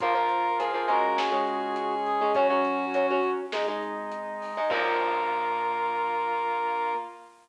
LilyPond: <<
  \new Staff \with { instrumentName = "Brass Section" } { \time 4/4 \key bes \minor \tempo 4 = 102 bes'4 aes'8 bes'8 aes'2 | ges'2 r2 | bes'1 | }
  \new Staff \with { instrumentName = "Clarinet" } { \time 4/4 \key bes \minor f'16 f'4~ f'16 ges'2 aes'8 | des'4. r2 r8 | bes1 | }
  \new Staff \with { instrumentName = "Acoustic Guitar (steel)" } { \time 4/4 \key bes \minor <f bes>16 <f bes>8. <f bes>16 <f bes>16 <aes des'>8. <aes des'>4. <aes des'>16 | <ges des'>16 <ges des'>8. <ges des'>16 <ges des'>8. <aes ees'>16 <aes ees'>4. <aes ees'>16 | <f bes>1 | }
  \new Staff \with { instrumentName = "Drawbar Organ" } { \time 4/4 \key bes \minor <bes f'>2 <aes des'>2 | <ges des'>2 <aes ees'>2 | <bes f'>1 | }
  \new Staff \with { instrumentName = "Synth Bass 1" } { \clef bass \time 4/4 \key bes \minor bes,,2 des,2 | ges,2 aes,,2 | bes,,1 | }
  \new Staff \with { instrumentName = "Pad 5 (bowed)" } { \time 4/4 \key bes \minor <bes f'>2 <aes des'>2 | <ges des'>2 <aes ees'>2 | <bes f'>1 | }
  \new DrumStaff \with { instrumentName = "Drums" } \drummode { \time 4/4 <hh bd>8 hh8 hh8 hh8 sn8 hh8 hh8 hh8 | <hh bd>8 hh8 hh8 hh8 sn8 hh8 hh8 hho8 | <cymc bd>4 r4 r4 r4 | }
>>